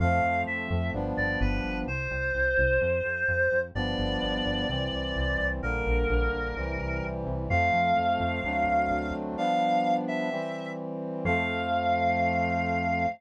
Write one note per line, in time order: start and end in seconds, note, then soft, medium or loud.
0.00 0.20 F2 medium
0.00 0.93 F3 loud
0.00 0.93 A3 medium
0.00 0.93 C4 medium
0.00 0.41 F5 medium
0.24 0.43 F2 medium
0.47 0.67 F2 medium
0.47 0.90 E5 medium
0.70 0.90 F2 medium
0.93 1.14 G1 medium
0.93 1.86 F3 loud
0.93 1.86 G3 loud
0.93 1.86 B3 medium
0.93 1.86 D4 loud
1.17 1.37 G1 medium
1.17 1.39 D5 medium
1.41 1.61 G1 medium
1.41 1.79 B4 medium
1.64 1.84 G1 medium
1.87 2.07 C2 medium
1.87 3.59 C5 medium
2.11 2.31 C2 medium
2.34 2.54 C2 medium
2.58 2.78 C2 medium
2.81 3.01 F2 medium
3.05 3.25 F2 medium
3.28 3.48 F2 medium
3.52 3.71 F2 medium
3.75 3.95 G1 medium
3.75 4.67 F3 loud
3.75 4.67 G3 loud
3.75 4.67 B3 loud
3.75 4.67 D4 loud
3.75 5.46 D5 loud
3.98 4.18 G1 medium
4.22 4.42 G1 medium
4.45 4.65 G1 medium
4.69 4.89 C2 medium
4.69 5.61 E3 medium
4.69 5.61 G3 loud
4.69 5.61 C4 loud
4.92 5.12 C2 medium
5.16 5.35 C2 medium
5.39 5.59 C2 medium
5.62 5.83 A#1 medium
5.62 6.55 D3 loud
5.62 6.55 G3 medium
5.62 6.55 A#3 loud
5.62 7.05 A#4 medium
5.86 6.06 A#1 medium
6.09 6.29 A#1 medium
6.33 6.53 A#1 medium
6.56 6.76 C2 medium
6.56 7.50 C3 loud
6.56 7.50 E3 loud
6.56 7.50 G3 loud
6.80 7.00 C2 medium
7.03 7.23 C2 medium
7.27 7.46 C2 medium
7.49 7.70 F2 medium
7.49 8.42 F3 loud
7.49 8.42 A3 loud
7.49 8.42 C4 medium
7.49 9.13 F5 loud
7.73 7.93 F2 medium
7.97 8.17 F2 medium
8.20 8.40 F2 medium
8.44 8.64 D2 medium
8.44 9.37 F#3 loud
8.44 9.37 A3 loud
8.44 9.37 C4 medium
8.44 9.36 D4 loud
8.67 8.87 D2 medium
8.91 9.11 D2 medium
9.14 9.34 D2 medium
9.37 10.29 F3 loud
9.37 10.29 G3 loud
9.37 10.29 B3 medium
9.37 10.29 D4 loud
9.37 9.94 F5 loud
10.08 10.70 E5 medium
10.31 11.24 E3 loud
10.31 11.24 G3 loud
10.31 11.24 C4 loud
11.25 13.06 F2 loud
11.25 13.06 F3 medium
11.25 13.06 A3 loud
11.25 13.06 C4 loud
11.25 13.06 F5 loud